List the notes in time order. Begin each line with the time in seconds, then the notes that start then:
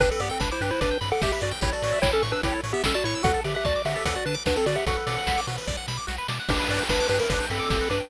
0.00 G1 D4 G4 B4, kick, closed hi-hat
0.11 C4 A4 B4
0.20 G2 B3 G4 D5, open hi-hat
0.29 C4 A4 G5
0.40 G1 D4 B4 B5, kick, snare
0.51 E4 C5 D6
0.61 G2 D4 G4 B4, open hi-hat
0.71 E4 B4 C5
0.81 G1 D4 B4 D5, kick, closed hi-hat
0.91 G5
1.01 G2 B5, open hi-hat
1.12 A4 F#5 D6
1.22 G1 G4 E5, kick, snare
1.32 G4 B4 E5
1.41 G2 F#4 D5, open hi-hat
1.51 G5
1.61 A1 E4 G4 C#5, kick, closed hi-hat
1.73 F#4 A4 D5
1.82 A2 C#5, open hi-hat
1.92 E5
2.01 A1 E4 C#5 G5, kick, snare
2.12 C#4 A4 A5
2.22 A2 C#6, open hi-hat
2.32 D4 B4 E6
2.43 A1 E4 G4 C#5, kick, closed hi-hat
2.52 A4
2.64 A2 C#5, open hi-hat
2.73 B3 G4 E5
2.84 A1 C#4 A4 G5, kick, snare
2.94 F#4 D5 A5
3.04 A2 E4 C#5 C#6, open hi-hat
3.15 E6
3.23 D2 F#4 A4 F#5, kick, closed hi-hat
3.34 A4
3.44 D3 G4 D5 E5, open hi-hat
3.55 G4 E5 F#5
3.65 D2 F#4 D5 A5, kick, snare
3.76 D6
3.85 D3 F#4 G4 E5, open hi-hat
3.96 A4
4.05 D2 A4 D5 F#5, kick, closed hi-hat
4.15 F#4 D5 F#5
4.25 D3 D4 B4 A5, open hi-hat
4.34 D6
4.46 D2 D4 F#4 B4, kick, snare
4.56 C4 A4
4.66 D3 F#4 D5, open hi-hat
4.75 G4 E5 F#5
4.86 B1 F#4 A4 F#5, kick, closed hi-hat
4.96 B4
5.07 B2 D5, open hi-hat
5.18 F#5
5.27 B1 B5, kick, snare
5.37 D6
5.47 B2 F#4, open hi-hat
5.58 B4
5.67 B1 D5, kick, snare
5.77 F#5
5.88 B2 B5, snare
5.97 D6
6.07 B1 F#4, snare
6.18 B4
6.28 B2 D5, snare
6.40 F#5
6.49 G1 D4 G4 B4, kick, crash
6.59 B4
6.69 G2 D5, open hi-hat
6.79 G5
6.89 G1 D4 B4 B5, kick, snare
7.00 D6
7.09 G2 D4 G4 B4, open hi-hat
7.19 A#4 B4
7.29 G1 D4 B4 D5, kick, closed hi-hat
7.40 G5
7.50 G2 C4 A4 B5, open hi-hat
7.60 D6
7.70 G1 G4, kick, snare
7.81 B4
7.90 G2 D4 B4 D5, open hi-hat
8.00 G5